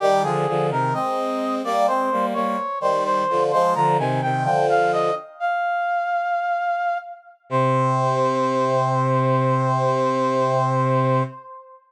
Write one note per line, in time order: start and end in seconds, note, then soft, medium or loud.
0.00 0.23 D#3 medium
0.00 0.23 G3 medium
0.00 0.22 G4 loud
0.23 0.46 D3 medium
0.23 0.46 F3 medium
0.23 0.67 G#4 loud
0.48 0.70 D3 medium
0.48 0.70 F3 medium
0.70 0.92 C3 medium
0.70 0.92 D#3 medium
0.70 0.94 A#4 loud
0.93 1.62 G#3 medium
0.93 1.62 C4 medium
0.93 1.56 D#5 medium
1.64 1.86 G3 medium
1.64 1.86 A#3 medium
1.64 1.87 D5 loud
1.87 2.09 G#3 medium
1.87 2.09 C4 medium
1.87 2.26 C5 loud
2.12 2.34 G3 medium
2.12 2.34 A#3 medium
2.34 2.56 G3 medium
2.34 2.56 A#3 medium
2.34 2.79 C#5 medium
2.80 3.23 D#3 medium
2.80 3.23 G3 medium
2.80 3.04 C5 loud
3.05 3.43 C5 loud
3.29 3.52 D3 medium
3.29 3.52 F3 medium
3.51 3.74 F3 medium
3.51 3.75 G#3 medium
3.51 3.74 C5 loud
3.75 3.97 D3 medium
3.75 3.97 F3 medium
3.75 3.97 A#5 loud
3.98 4.20 C3 medium
3.98 4.20 D#3 medium
3.98 4.21 G#5 loud
4.21 4.45 C3 medium
4.21 4.45 D#3 medium
4.21 4.44 G5 loud
4.44 5.10 D3 medium
4.44 5.10 F3 medium
4.44 4.67 G5 loud
4.69 4.92 F5 loud
4.93 5.15 D#5 loud
5.40 6.98 F5 loud
7.49 11.22 C3 loud
7.49 11.23 C5 loud